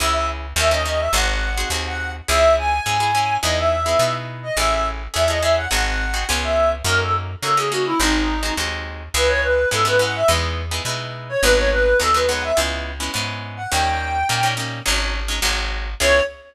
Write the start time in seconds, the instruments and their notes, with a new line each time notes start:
0.00 electric bass (finger) C#2, acoustic guitar (steel) C#4 E4 G#4, clarinet E5
0.13 clarinet E5
0.56 electric bass (finger) D#2, acoustic guitar (steel) C#4 D#4 G4 A#4, clarinet E5
0.71 acoustic guitar (steel) C#4 D#4 G4 A#4, clarinet D#5
0.85 acoustic guitar (steel) C#4 D#4 G4 A#4, clarinet D#5
0.99 clarinet E5
1.13 electric bass (finger) G#1, acoustic guitar (steel) C4 D#4 F#4 G#4, clarinet F#5
1.57 acoustic guitar (steel) C4 D#4 F#4 G#4
1.70 electric bass (finger) D#2, acoustic guitar (steel) C4 D#4 F#4 G#4
1.87 clarinet F#5
2.28 electric bass (finger) C#2, acoustic guitar (steel) C#4 E4 G#4, clarinet E5
2.58 clarinet G#5
2.86 electric bass (finger) G#2, acoustic guitar (steel) C#4 E4 G#4
3.00 acoustic guitar (steel) C#4 E4 G#4
3.15 acoustic guitar (steel) C#4 E4 G#4
3.43 electric bass (finger) E2, acoustic guitar (steel) B3 D#4 E4 G#4, clarinet D#5
3.58 clarinet E5
3.86 acoustic guitar (steel) B3 D#4 E4 G#4
3.99 electric bass (finger) B2, acoustic guitar (steel) B3 D#4 E4 G#4
4.43 clarinet D#5
4.57 electric bass (finger) A1, acoustic guitar (steel) C#4 E4 G#4 A4, clarinet E5
4.72 clarinet E5
5.14 electric bass (finger) E2, acoustic guitar (steel) C#4 E4 G#4 A4, clarinet E5
5.28 acoustic guitar (steel) C#4 E4 G#4 A4, clarinet D#5
5.41 acoustic guitar (steel) C#4 E4 G#4 A4, clarinet E5
5.57 clarinet F#5
5.71 electric bass (finger) G#1, acoustic guitar (steel) C4 D#4 F#4 G#4, clarinet F#5
6.14 acoustic guitar (steel) C4 D#4 F#4 G#4
6.29 electric bass (finger) C#2, acoustic guitar (steel) B3 C#4 F4 G#4
6.43 clarinet E5
6.84 electric bass (finger) F#2, acoustic guitar (steel) A#3 C#4 D#4 F#4, clarinet A#4
7.01 clarinet A4
7.43 electric bass (finger) C#3, acoustic guitar (steel) A#3 C#4 D#4 F#4, clarinet A4
7.57 acoustic guitar (steel) A#3 C#4 D#4 F#4, clarinet G#4
7.71 acoustic guitar (steel) A#3 C#4 D#4 F#4, clarinet F#4
7.86 clarinet E4
8.00 electric bass (finger) G#1, acoustic guitar (steel) G#3 C4 D#4 F#4, clarinet D#4
8.43 acoustic guitar (steel) G#3 C4 D#4 F#4
8.57 electric bass (finger) D#2, acoustic guitar (steel) G#3 C4 D#4 F#4
9.14 electric bass (finger) C#2, acoustic guitar (steel) G#3 B3 C#4 E4, clarinet B4
9.28 clarinet C#5
9.42 clarinet B4
9.71 electric bass (finger) G#2, acoustic guitar (steel) G#3 B3 C#4 E4, clarinet A4
9.85 acoustic guitar (steel) G#3 B3 C#4 E4, clarinet B4
9.99 acoustic guitar (steel) G#3 B3 C#4 E4, clarinet F#5
10.15 clarinet E5
10.28 electric bass (finger) E2, acoustic guitar (steel) G#3 B3 D#4 E4
10.71 acoustic guitar (steel) G#3 B3 D#4 E4
10.85 electric bass (finger) B2, acoustic guitar (steel) G#3 B3 D#4 E4
11.29 clarinet C#5
11.42 electric bass (finger) G#1, acoustic guitar (steel) F#3 G#3 B3 D#4, clarinet B4
11.56 clarinet C#5
11.71 clarinet B4
12.00 electric bass (finger) D#2, acoustic guitar (steel) F#3 G#3 B3 D#4, clarinet A4
12.14 acoustic guitar (steel) F#3 G#3 B3 D#4, clarinet B4
12.28 acoustic guitar (steel) F#3 G#3 B3 D#4, clarinet F#5
12.43 clarinet E5
12.57 electric bass (finger) C#2, acoustic guitar (steel) G#3 B3 C#4 E4
13.00 acoustic guitar (steel) G#3 B3 C#4 E4
13.14 electric bass (finger) G#2, acoustic guitar (steel) G#3 B3 C#4 E4
13.57 clarinet F#5
13.70 electric bass (finger) D#2, acoustic guitar (steel) G3 A#3 C#4 D#4, clarinet G5
14.29 electric bass (finger) A#2, acoustic guitar (steel) G3 A#3 C#4 D#4
14.43 acoustic guitar (steel) G3 A#3 C#4 D#4
14.57 acoustic guitar (steel) G3 A#3 C#4 D#4
14.86 electric bass (finger) G#1, acoustic guitar (steel) F#3 G#3 C#4 D#4
15.28 acoustic guitar (steel) F#3 G#3 C#4 D#4
15.42 electric bass (finger) G#1, acoustic guitar (steel) F#3 G#3 C4 D#4
16.00 electric bass (finger) C#2, acoustic guitar (steel) B3 C#4 E4 G#4, clarinet C#5